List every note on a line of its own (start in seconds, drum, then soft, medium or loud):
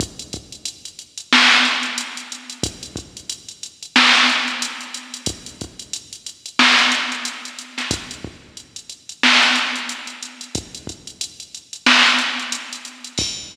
0.00 kick loud
0.00 closed hi-hat loud
0.19 closed hi-hat medium
0.33 kick medium
0.33 closed hi-hat medium
0.52 closed hi-hat medium
0.65 closed hi-hat loud
0.85 closed hi-hat medium
0.99 closed hi-hat medium
1.18 closed hi-hat medium
1.33 snare loud
1.51 closed hi-hat medium
1.65 closed hi-hat medium
1.83 closed hi-hat medium
1.98 closed hi-hat loud
2.17 closed hi-hat medium
2.32 closed hi-hat medium
2.50 closed hi-hat medium
2.63 kick loud
2.63 closed hi-hat loud
2.83 closed hi-hat medium
2.96 kick medium
2.96 closed hi-hat medium
3.17 closed hi-hat medium
3.30 closed hi-hat loud
3.48 closed hi-hat medium
3.63 closed hi-hat medium
3.83 closed hi-hat medium
3.96 snare loud
4.15 closed hi-hat medium
4.30 closed hi-hat medium
4.48 closed hi-hat medium
4.62 closed hi-hat loud
4.81 closed hi-hat medium
4.94 closed hi-hat loud
5.14 closed hi-hat medium
5.26 kick loud
5.26 closed hi-hat loud
5.46 closed hi-hat medium
5.61 kick medium
5.61 closed hi-hat medium
5.79 closed hi-hat medium
5.93 closed hi-hat loud
6.13 closed hi-hat medium
6.26 closed hi-hat medium
6.46 closed hi-hat medium
6.59 snare loud
6.79 closed hi-hat medium
6.92 closed hi-hat loud
7.12 closed hi-hat medium
7.25 closed hi-hat loud
7.45 closed hi-hat medium
7.59 closed hi-hat medium
7.78 snare soft
7.78 closed hi-hat medium
7.91 kick loud
7.91 closed hi-hat loud
8.11 closed hi-hat medium
8.25 kick medium
8.57 closed hi-hat medium
8.76 closed hi-hat medium
8.90 closed hi-hat medium
9.09 closed hi-hat medium
9.23 snare loud
9.43 closed hi-hat medium
9.55 closed hi-hat medium
9.76 closed hi-hat medium
9.89 closed hi-hat loud
10.07 closed hi-hat medium
10.23 closed hi-hat medium
10.41 closed hi-hat medium
10.55 kick loud
10.55 closed hi-hat loud
10.75 closed hi-hat medium
10.87 kick medium
10.87 closed hi-hat medium
11.07 closed hi-hat medium
11.21 closed hi-hat loud
11.40 closed hi-hat medium
11.55 closed hi-hat medium
11.73 closed hi-hat medium
11.86 snare loud
12.06 closed hi-hat medium
12.19 closed hi-hat medium
12.39 closed hi-hat medium
12.52 closed hi-hat loud
12.73 closed hi-hat medium
12.85 closed hi-hat medium
13.04 closed hi-hat medium
13.18 kick loud
13.18 crash loud